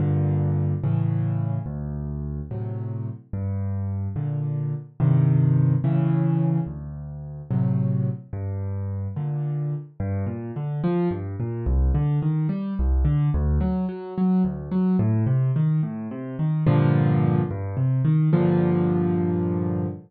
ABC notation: X:1
M:6/8
L:1/8
Q:3/8=72
K:Gm
V:1 name="Acoustic Grand Piano" clef=bass
[G,,B,,D,]3 [A,,^C,=E,]3 | D,,3 [A,,C,^F,]3 | G,,3 [B,,D,]3 | [G,,C,E,]3 [A,,^C,=E,]3 |
D,,3 [A,,C,^F,]3 | G,,3 [B,,D,]3 | G,, B,, D, F, G,, B,, | C,, D, E, G, C,, D, |
D,, ^F, F, F, D,, F, | A,, C, E, A,, C, E, | [G,,B,,D,F,]3 G,, C, E, | [G,,B,,D,F,]6 |]